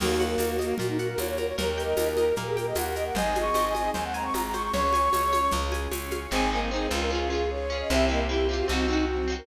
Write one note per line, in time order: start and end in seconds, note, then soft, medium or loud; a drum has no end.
0.00 0.36 D#2 medium
0.00 0.78 A#3 medium
0.00 0.56 A#3 loud
0.00 0.78 D#4 medium
0.00 0.24 F#4 loud
0.00 0.78 F#4 medium
0.00 0.39 A#4 medium
0.00 crash loud
0.00 low conga loud
0.00 shaker medium
0.20 0.99 F#5 medium
0.20 high conga medium
0.20 shaker medium
0.26 0.50 A#4 loud
0.38 0.73 D#2 medium
0.38 0.78 A#4 medium
0.38 tambourine medium
0.38 high conga medium
0.38 shaker medium
0.52 0.75 F#4 medium
0.59 0.78 A#3 loud
0.59 1.18 D#5 medium
0.59 high conga medium
0.59 shaker medium
0.78 1.15 A#2 medium
0.78 1.57 A#3 medium
0.78 0.87 F#4 loud
0.78 1.57 F#4 medium
0.78 1.38 A#4 medium
0.78 1.57 A#4 medium
0.78 low conga medium
0.78 shaker medium
0.88 0.98 D#4 loud
0.98 1.08 F#4 loud
0.98 1.56 F#5 medium
0.98 shaker medium
1.09 1.19 A#4 loud
1.18 1.53 D#2 medium
1.18 1.28 C#5 medium
1.18 1.56 D#5 medium
1.18 tambourine medium
1.18 high conga medium
1.18 shaker medium
1.28 1.38 C#5 loud
1.37 1.47 A#4 medium
1.37 1.57 A#4 medium
1.37 high conga medium
1.37 shaker medium
1.47 1.57 C#5 loud
1.58 1.94 D#2 medium
1.58 2.36 A#3 medium
1.58 2.36 D#4 medium
1.58 2.36 G4 medium
1.58 1.82 A#4 loud
1.58 2.11 A#4 loud
1.58 1.97 A#4 loud
1.58 low conga medium
1.58 shaker medium
1.78 2.56 G5 medium
1.78 shaker medium
1.84 2.08 D#5 medium
1.97 2.33 D#2 medium
1.97 2.37 A#4 medium
1.97 tambourine medium
1.97 high conga medium
1.97 shaker medium
2.12 2.35 A#4 medium
2.16 2.34 A#4 loud
2.16 2.76 D#5 medium
2.16 high conga medium
2.16 shaker medium
2.36 2.73 A#2 medium
2.36 3.15 A#3 medium
2.36 3.15 G4 medium
2.36 3.15 A#4 medium
2.36 2.95 A#4 medium
2.36 2.48 A#4 medium
2.36 low conga medium
2.36 shaker medium
2.47 2.56 G#4 medium
2.57 2.66 A#4 loud
2.57 3.13 G5 medium
2.57 high conga medium
2.57 shaker medium
2.67 2.76 D#5 medium
2.75 3.11 D#2 medium
2.75 3.14 D#5 medium
2.75 2.85 F#5 loud
2.75 tambourine medium
2.75 high conga medium
2.75 shaker medium
2.86 2.95 F#5 medium
2.95 3.15 A#4 medium
2.95 3.05 D#5 loud
2.95 shaker medium
3.06 3.15 F#5 medium
3.15 3.50 G#1 medium
3.15 3.94 C4 medium
3.15 3.94 D#4 medium
3.15 3.94 G#4 medium
3.15 3.55 C5 medium
3.15 3.74 D#5 loud
3.15 3.38 G#5 loud
3.15 low conga loud
3.15 shaker medium
3.35 4.14 G#5 medium
3.35 high conga medium
3.35 shaker medium
3.41 3.65 C#6 loud
3.54 3.90 G#1 medium
3.54 3.94 C5 medium
3.54 tambourine medium
3.54 high conga medium
3.54 shaker medium
3.68 3.90 G#5 loud
3.75 4.33 D#5 medium
3.75 3.91 D#5 medium
3.75 high conga medium
3.75 shaker medium
3.94 4.30 D#2 medium
3.94 4.73 G#3 medium
3.94 4.73 C4 medium
3.94 4.73 G#4 medium
3.94 4.53 C5 medium
3.94 4.04 G#5 medium
3.94 low conga medium
3.94 shaker medium
4.05 4.14 F#5 loud
4.14 4.70 G#5 medium
4.14 4.24 A#5 loud
4.14 shaker medium
4.24 4.34 C#6 medium
4.33 4.70 G#1 medium
4.33 4.71 D#5 medium
4.33 4.43 A#5 loud
4.33 tambourine medium
4.33 high conga medium
4.33 shaker medium
4.44 4.54 A#5 medium
4.53 4.73 C5 medium
4.53 4.62 C#6 medium
4.53 high conga medium
4.53 shaker medium
4.63 4.72 C#6 medium
4.73 5.09 C#2 medium
4.73 5.13 C#4 medium
4.73 5.13 F#4 medium
4.73 5.13 G#4 medium
4.73 5.55 C#5 loud
4.73 5.13 C#5 medium
4.73 5.51 C#6 loud
4.73 low conga loud
4.73 shaker medium
4.93 5.50 G#5 medium
4.93 high conga medium
4.93 shaker medium
5.13 5.49 C#2 medium
5.13 5.52 C#4 medium
5.13 5.52 G#4 medium
5.13 5.32 C#5 medium
5.13 5.53 C#5 medium
5.13 tambourine medium
5.13 high conga medium
5.13 shaker medium
5.33 5.92 C#5 medium
5.33 high conga medium
5.33 shaker medium
5.51 5.88 C#2 medium
5.51 5.92 C#4 medium
5.51 5.92 F4 medium
5.51 5.92 G#4 medium
5.51 low conga medium
5.51 shaker medium
5.72 6.28 G#5 medium
5.72 high conga medium
5.72 shaker medium
5.91 6.27 C#2 medium
5.91 6.31 C#4 medium
5.91 6.31 G#4 medium
5.91 6.30 C#5 medium
5.91 6.31 C#5 medium
5.91 tambourine medium
5.91 high conga medium
5.91 shaker medium
6.11 6.30 F5 medium
6.11 high conga medium
6.11 shaker medium
6.31 6.88 G#1 medium
6.31 6.49 C4 medium
6.31 6.48 C4 loud
6.31 6.71 C4 medium
6.31 6.71 D#4 loud
6.31 6.49 D#4 medium
6.31 6.71 G#4 medium
6.31 6.50 G#5 loud
6.36 6.49 G#4 loud
6.51 6.68 A#3 medium
6.51 6.69 C4 medium
6.51 6.69 D#4 medium
6.51 6.60 G#5 loud
6.55 6.69 G#4 medium
6.70 7.11 G#3 loud
6.70 6.89 C4 medium
6.70 7.11 C4 medium
6.70 6.87 D#4 loud
6.70 6.89 D#4 medium
6.70 7.10 G#4 medium
6.70 6.88 C5 loud
6.76 6.89 G#4 medium
6.90 7.83 C#2 loud
6.90 7.09 C4 medium
6.90 7.09 D#4 medium
6.90 7.09 F4 medium
6.95 7.09 G#4 medium
7.01 7.10 A#4 medium
7.10 7.28 C#4 medium
7.10 7.49 C#4 medium
7.10 7.42 F4 medium
7.10 7.49 F4 loud
7.10 7.29 F4 medium
7.10 7.28 F4 medium
7.10 7.49 G#4 medium
7.15 7.28 G#4 medium
7.30 7.66 C#4 medium
7.30 7.66 F4 medium
7.30 7.50 G#4 medium
7.35 7.66 G#4 medium
7.50 7.89 C#4 loud
7.50 7.89 G#4 medium
7.50 7.89 C#5 medium
7.50 7.78 C#5 medium
7.70 7.88 C#4 medium
7.70 7.88 F4 medium
7.74 7.88 G#4 medium
7.81 7.90 D#5 medium
7.89 8.63 C2 loud
7.89 8.28 C4 medium
7.89 8.06 C4 loud
7.89 8.08 C4 medium
7.89 8.28 E4 medium
7.89 8.08 E4 medium
7.89 8.28 G4 loud
7.89 8.06 E5 loud
7.95 8.08 G4 medium
8.09 8.26 A#3 loud
8.09 8.27 C4 medium
8.09 8.27 E4 medium
8.09 8.19 D#5 medium
8.13 8.27 G4 medium
8.28 8.47 C4 medium
8.28 8.67 C4 medium
8.28 8.45 E4 medium
8.28 8.47 E4 medium
8.28 8.68 G4 loud
8.28 8.47 G4 loud
8.28 8.68 C5 medium
8.34 8.47 G4 medium
8.49 8.67 C4 medium
8.49 8.67 E4 medium
8.49 8.66 F4 medium
8.53 8.67 G4 medium
8.59 8.68 F#4 medium
8.68 9.42 C2 medium
8.68 9.07 C4 loud
8.68 8.86 C4 medium
8.68 8.87 C4 medium
8.68 9.07 D#4 loud
8.68 8.86 D#4 medium
8.68 9.07 F#4 medium
8.72 8.86 F#4 medium
8.88 9.25 C4 medium
8.88 9.05 D#4 loud
8.88 9.25 D#4 medium
8.93 9.25 F#4 medium
9.07 9.46 F#3 medium
9.07 9.46 C4 medium
9.07 9.35 F#4 medium
9.07 9.46 F#4 medium
9.28 9.46 C4 medium
9.28 9.46 D#4 medium
9.32 9.46 F#4 medium
9.38 9.46 A#4 loud